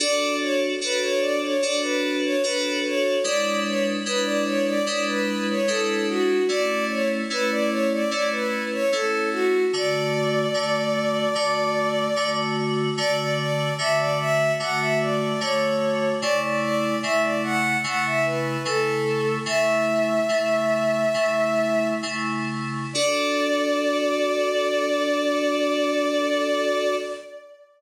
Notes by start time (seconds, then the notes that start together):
0.00 D4 F#4 A4 D5
0.41 C#5
0.81 D4 F#4 A4 B4
1.02 C#5
1.20 D5
1.42 C#5
1.62 D4 F#4 A4 D5
1.82 B4
2.23 C#5
2.43 D4 F#4 A4 B4
2.84 C#5
3.23 G#3 D4 E4 B4 D5
3.64 C#5
4.06 G#3 D4 E4 B4
4.24 D5
4.44 C#5
4.66 D5
4.86 G#3 D4 E4 B4 D5
5.07 B4
5.48 C#5
5.67 G#3 D4 E4 A4 B4
6.08 F#4
6.48 A3 C#4 E4 D5
6.88 C#5
7.30 A3 C#4 E4 B4
7.50 D5
7.69 C#5
7.91 D5
8.10 A3 C#4 E4 D5
8.31 B4
8.71 C#5
8.92 A3 C#4 E4 A4
9.32 F#4
9.73 D3 A3 F#4 D5
10.54 D3 A3 F#4
11.35 D3 A3 F#4
12.16 D3 A3 F#4
12.97 D3 A3 F#4 D5
13.17 D5
13.39 D5
13.78 D3 A3 F#4 E5
13.98 D5
14.19 E5
14.59 D3 A3 F#4 F#5
14.79 E5
15.01 D5
15.40 D3 A3 F#4 C#5
16.20 C#3 A3 E4 D5
16.42 D5
16.61 D5
17.03 C#3 A3 E4 E5
17.22 D5
17.43 F#5
17.84 C#3 A3 E4 F#5
18.06 E5
18.25 B4
18.65 C#3 A3 E4 A4
19.45 C#3 A3 E4 E5
20.29 C#3 A3 E4
21.14 C#3 A3 E4
22.02 C#3 A3 E4
22.93 D4 F#4 A4 D5